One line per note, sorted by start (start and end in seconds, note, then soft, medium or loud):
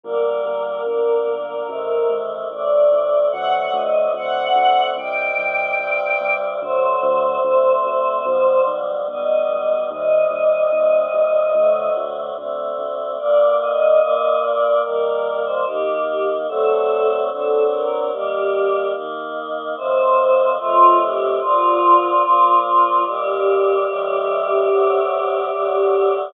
0.04 0.39 G1 medium
0.04 0.85 D3 medium
0.04 0.85 G3 medium
0.04 0.85 A#3 medium
0.04 2.13 A#4 medium
0.45 0.80 G1 medium
0.86 1.21 G1 medium
0.86 1.67 D3 medium
0.86 1.67 A#3 medium
0.86 1.67 D4 medium
1.27 1.62 G1 medium
1.68 2.04 A1 medium
1.68 2.49 C3 medium
1.68 2.49 D#3 medium
1.68 2.49 A3 medium
2.10 2.45 A1 medium
2.50 2.86 A1 medium
2.50 3.32 A2 medium
2.50 3.32 C3 medium
2.50 3.32 A3 medium
2.50 3.24 D5 medium
2.92 3.27 A1 medium
3.32 3.68 D2 medium
3.32 4.14 C3 medium
3.32 4.14 D3 medium
3.32 4.14 F#3 medium
3.32 4.14 A3 medium
3.32 3.52 F#5 medium
3.53 3.73 F#5 medium
3.73 4.08 D2 medium
3.73 4.11 D#5 medium
4.14 4.49 D2 medium
4.14 4.96 C3 medium
4.14 4.96 D3 medium
4.14 4.96 A3 medium
4.14 4.96 C4 medium
4.14 4.88 F#5 medium
4.56 4.91 D2 medium
4.96 5.31 C2 medium
4.96 5.78 C3 medium
4.96 5.79 D#3 medium
4.96 5.78 G3 medium
4.96 6.33 G5 medium
5.38 5.73 C2 medium
5.79 6.14 C2 medium
5.79 6.60 G2 medium
5.79 6.60 C3 medium
5.79 6.60 G3 medium
6.21 6.55 C2 medium
6.62 6.97 D2 medium
6.62 7.43 C3 medium
6.62 7.43 D3 medium
6.62 7.43 F#3 medium
6.62 7.43 A3 medium
6.62 8.66 C5 medium
7.03 7.38 D2 medium
7.44 7.79 D2 medium
7.44 8.25 C3 medium
7.44 8.25 D3 medium
7.44 8.25 A3 medium
7.44 8.25 C4 medium
7.85 8.20 D2 medium
8.25 8.60 B1 loud
8.25 9.07 B2 medium
8.25 9.07 D3 medium
8.25 9.07 F3 medium
8.25 9.07 G3 medium
8.67 9.02 B1 medium
9.08 9.43 B1 medium
9.08 9.90 B2 medium
9.08 9.90 D3 medium
9.08 9.90 G3 medium
9.08 9.90 B3 medium
9.08 9.84 D#5 medium
9.49 9.84 B1 medium
9.90 10.26 D#2 medium
9.90 10.72 C3 medium
9.90 10.72 D#3 medium
9.90 10.72 G3 medium
9.90 11.89 D#5 medium
10.31 10.66 D#2 medium
10.72 11.07 D#2 medium
10.72 11.54 G2 medium
10.72 11.54 C3 medium
10.72 11.54 G3 medium
11.14 11.49 D#2 medium
11.54 11.89 D2 loud
11.54 12.36 C3 medium
11.54 12.36 D3 medium
11.54 12.36 F#3 medium
11.54 12.36 A3 medium
11.97 12.32 D2 medium
12.36 12.73 D2 medium
12.36 13.18 C3 medium
12.36 13.18 D3 medium
12.36 13.18 A3 medium
12.36 13.18 C4 medium
12.79 13.14 D2 medium
13.19 14.00 G2 medium
13.19 14.00 D3 medium
13.19 14.00 A#3 medium
13.19 13.53 D5 medium
13.60 14.40 D#5 medium
14.01 14.83 G2 medium
14.01 14.83 A#2 medium
14.01 14.83 A#3 medium
14.42 14.82 D5 medium
14.83 15.65 D#3 medium
14.83 15.65 G3 medium
14.83 15.65 A#3 medium
14.83 15.41 A#4 medium
15.45 15.65 C5 medium
15.66 16.47 D#3 medium
15.66 16.47 A#3 medium
15.66 16.47 D#4 medium
15.66 16.01 G4 medium
16.07 16.27 G4 medium
16.48 17.29 D3 medium
16.48 17.29 F#3 medium
16.48 17.29 A3 medium
16.48 17.29 C4 medium
16.48 17.16 A4 medium
17.30 18.12 D3 medium
17.30 18.12 F#3 medium
17.30 18.12 C4 medium
17.30 18.12 D4 medium
17.30 17.63 A4 medium
17.71 18.07 A#4 medium
18.12 18.93 D#3 medium
18.12 18.94 G3 medium
18.12 18.93 A#3 medium
18.12 18.86 G4 medium
18.94 19.75 D#3 medium
18.94 19.75 A#3 medium
18.94 19.75 D#4 medium
19.76 20.58 A2 medium
19.76 20.58 D#3 medium
19.76 20.58 F3 medium
19.76 20.58 C4 medium
19.76 20.48 C5 medium
20.59 21.40 A2 medium
20.59 21.40 D#3 medium
20.59 21.40 A3 medium
20.59 21.40 C4 medium
20.59 20.98 F4 medium
21.00 21.35 G4 medium
21.40 22.22 A#2 medium
21.40 22.22 D3 medium
21.40 22.22 F3 medium
21.40 22.59 F4 medium
22.23 23.05 A#2 medium
22.23 23.05 F3 medium
22.23 23.05 A#3 medium
22.64 23.02 F4 medium
23.05 23.86 D#2 medium
23.05 23.86 A#2 medium
23.05 23.86 G3 medium
23.05 26.15 G4 medium
23.88 24.69 C#2 medium
23.88 24.69 A2 medium
23.88 24.69 E3 medium
23.88 24.69 G3 medium
24.70 25.51 D2 medium
24.70 25.51 A2 medium
24.70 25.51 C3 medium
24.70 25.51 F#3 medium
25.52 26.33 D2 medium
25.52 26.33 A2 medium
25.52 26.33 D3 medium
25.52 26.33 F#3 medium